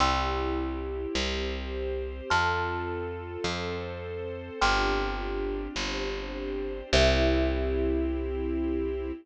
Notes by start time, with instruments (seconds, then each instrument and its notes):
0.00 electric bass (finger) C2, string ensemble 1 C4 E4 G4, kalimba G5 C6 E6
1.15 electric bass (finger) C2, string ensemble 1 C4 G4 C5
2.30 electric bass (finger) F2, string ensemble 1 C4 F4 A4, kalimba A5 C6 F6
3.44 electric bass (finger) F2, string ensemble 1 C4 A4 C5
4.61 electric bass (finger) G1, string ensemble 1 C4 D4 F4 G4, kalimba G5 C6 D6 F6
5.76 electric bass (finger) G1, string ensemble 1 C4 D4 G4 C5
6.92 electric bass (finger) C2, string ensemble 1 C4 E4 G4, kalimba G4 C5 E5